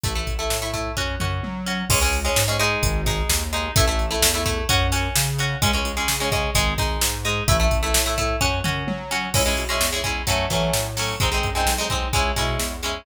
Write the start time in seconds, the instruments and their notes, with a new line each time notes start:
0.03 synth bass 1 A1, acoustic guitar (steel) A3 E4, kick, closed hi-hat
0.15 acoustic guitar (steel) A3 E4
0.27 synth bass 1 A1, kick, closed hi-hat
0.39 acoustic guitar (steel) A3 E4
0.50 synth bass 1 A2, snare
0.62 acoustic guitar (steel) A3 E4
0.74 acoustic guitar (steel) A3 E4, kick, closed hi-hat
0.97 synth bass 1 F#2, acoustic guitar (steel) C#4 F#4, kick
1.20 synth bass 1 F#2, acoustic guitar (steel) C#4 F#4, mid tom
1.43 synth bass 1 F#3, high tom
1.66 acoustic guitar (steel) C#4 F#4
1.89 synth bass 1 C#2, acoustic guitar (steel) G#3 C#4, kick, crash
2.01 acoustic guitar (steel) G#3 C#4
2.13 closed hi-hat
2.25 acoustic guitar (steel) G#3 C#4
2.36 synth bass 1 G#2, snare
2.48 acoustic guitar (steel) G#3 C#4
2.59 acoustic guitar (steel) G#3 D#4, closed hi-hat
2.83 synth bass 1 G#1, kick, closed hi-hat
3.06 acoustic guitar (steel) G#3 D#4, kick, snare, closed hi-hat
3.29 synth bass 1 D#2, snare
3.53 acoustic guitar (steel) G#3 D#4, closed hi-hat
3.76 synth bass 1 A1, acoustic guitar (steel) A3 E4, kick, closed hi-hat
3.87 acoustic guitar (steel) A3 E4
3.99 closed hi-hat
4.11 acoustic guitar (steel) A3 E4
4.22 synth bass 1 E2, snare
4.34 acoustic guitar (steel) A3 E4
4.46 acoustic guitar (steel) A3 E4, kick, closed hi-hat
4.69 synth bass 1 F#2, acoustic guitar (steel) C#4 F#4, kick, closed hi-hat
4.92 acoustic guitar (steel) C#4 F#4, snare, closed hi-hat
5.16 synth bass 1 C#3, snare
5.38 acoustic guitar (steel) C#4 F#4, closed hi-hat
5.62 synth bass 1 C#2, acoustic guitar (steel) G#3 C#4, kick, closed hi-hat
5.73 acoustic guitar (steel) G#3 C#4
5.85 synth bass 1 C#2, closed hi-hat
5.97 acoustic guitar (steel) G#3 C#4
6.08 synth bass 1 C#3, snare
6.20 acoustic guitar (steel) G#3 C#4
6.32 acoustic guitar (steel) G#3 C#4, kick, closed hi-hat
6.55 synth bass 1 G#1, acoustic guitar (steel) G#3 D#4, kick, closed hi-hat
6.78 synth bass 1 G#1, acoustic guitar (steel) G#3 D#4, kick, snare, closed hi-hat
7.01 synth bass 1 G#2, snare
7.25 acoustic guitar (steel) G#3 D#4, closed hi-hat
7.48 synth bass 1 A1, acoustic guitar (steel) A3 E4, kick, closed hi-hat
7.60 acoustic guitar (steel) A3 E4
7.71 synth bass 1 A1, kick, closed hi-hat
7.83 acoustic guitar (steel) A3 E4
7.94 synth bass 1 A2, snare
8.06 acoustic guitar (steel) A3 E4
8.18 acoustic guitar (steel) A3 E4, kick, closed hi-hat
8.41 synth bass 1 F#2, acoustic guitar (steel) C#4 F#4, kick
8.64 synth bass 1 F#2, acoustic guitar (steel) C#4 F#4, mid tom
8.87 synth bass 1 F#3, high tom
9.11 acoustic guitar (steel) C#4 F#4
9.34 synth bass 1 C#2, acoustic guitar (steel) G#3 C#4 E4, kick, crash
9.46 acoustic guitar (steel) G#3 C#4 E4
9.57 synth bass 1 B2, closed hi-hat
9.69 acoustic guitar (steel) G#3 C#4 E4
9.80 synth bass 1 E2, snare
9.92 acoustic guitar (steel) G#3 C#4 E4
10.04 acoustic guitar (steel) G#3 C#4 E4, kick, closed hi-hat
10.27 synth bass 1 F#2, acoustic guitar (steel) F#3 A3 C#4, kick, closed hi-hat
10.50 synth bass 1 E3, acoustic guitar (steel) F#3 A3 C#4, kick, snare, closed hi-hat
10.73 synth bass 1 A2, snare
10.97 acoustic guitar (steel) F#3 A3 C#4, open hi-hat
11.20 synth bass 1 G#1, acoustic guitar (steel) G#3 C4 D#4, kick, closed hi-hat
11.32 acoustic guitar (steel) G#3 C4 D#4
11.43 synth bass 1 F#2, kick, closed hi-hat
11.55 acoustic guitar (steel) G#3 C4 D#4
11.66 synth bass 1 B1, snare
11.78 acoustic guitar (steel) G#3 C4 D#4
11.90 acoustic guitar (steel) G#3 C4 D#4, kick, closed hi-hat
12.13 synth bass 1 C#2, acoustic guitar (steel) G#3 C#4 E4, kick, closed hi-hat
12.36 synth bass 1 B2, acoustic guitar (steel) G#3 C#4 E4, kick, snare, closed hi-hat
12.59 synth bass 1 E2, snare
12.83 acoustic guitar (steel) G#3 C#4 E4, closed hi-hat